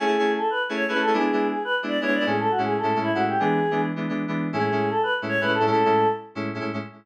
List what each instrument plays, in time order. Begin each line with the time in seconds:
0.00 electric piano 2 A3 C#4 E4 G#4, choir aahs G#4
0.07 electric piano 2 A3 C#4 E4 G#4
0.19 electric piano 2 A3 C#4 E4 G#4
0.38 choir aahs A4
0.50 choir aahs B4
0.69 electric piano 2 A3 C#4 E4 G#4
0.75 choir aahs C#5
0.88 electric piano 2 A3 C#4 E4 G#4, choir aahs B4
0.94 electric piano 2 A3 C#4 E4 G#4
1.01 choir aahs A4
1.07 electric piano 2 A3 C#4 E4 G#4
1.13 electric piano 2 G#3 B3 D4 E4, choir aahs G#4
1.20 electric piano 2 G#3 B3 D4 E4
1.32 electric piano 2 G#3 B3 D4 E4
1.51 choir aahs G#4
1.64 choir aahs B4
1.83 electric piano 2 G#3 B3 D4 E4
1.88 choir aahs D5
2.01 electric piano 2 G#3 B3 D4 E4, choir aahs C#5
2.07 electric piano 2 G#3 B3 D4 E4
2.14 choir aahs D5
2.20 electric piano 2 G#3 B3 D4 E4
2.26 electric piano 2 A2 G#3 C#4 E4, choir aahs G#4
2.39 choir aahs A4
2.51 choir aahs F#4
2.58 electric piano 2 A2 G#3 C#4 E4
2.65 choir aahs G#4
2.78 choir aahs A4
2.83 electric piano 2 A2 G#3 C#4 E4
2.95 electric piano 2 A2 G#3 C#4 E4
3.02 choir aahs E4
3.14 electric piano 2 A2 G#3 C#4 E4, choir aahs F#4
3.28 choir aahs G4
3.39 electric piano 2 E3 G#3 B3 D4, choir aahs G#4
3.71 electric piano 2 E3 G#3 B3 D4
3.96 electric piano 2 E3 G#3 B3 D4
4.09 electric piano 2 E3 G#3 B3 D4
4.28 electric piano 2 E3 G#3 B3 D4
4.53 electric piano 2 A2 G#3 C#4 E4, choir aahs G#4
4.59 electric piano 2 A2 G#3 C#4 E4
4.72 electric piano 2 A2 G#3 C#4 E4
4.90 choir aahs A4
5.03 choir aahs B4
5.22 electric piano 2 A2 G#3 C#4 E4
5.28 choir aahs C#5
5.41 electric piano 2 A2 G#3 C#4 E4, choir aahs B4
5.47 electric piano 2 A2 G#3 C#4 E4
5.54 choir aahs A4
5.60 electric piano 2 A2 G#3 C#4 E4
5.66 electric piano 2 A2 G#3 C#4 E4, choir aahs A4
5.72 electric piano 2 A2 G#3 C#4 E4
5.85 electric piano 2 A2 G#3 C#4 E4
6.35 electric piano 2 A2 G#3 C#4 E4
6.54 electric piano 2 A2 G#3 C#4 E4
6.60 electric piano 2 A2 G#3 C#4 E4
6.73 electric piano 2 A2 G#3 C#4 E4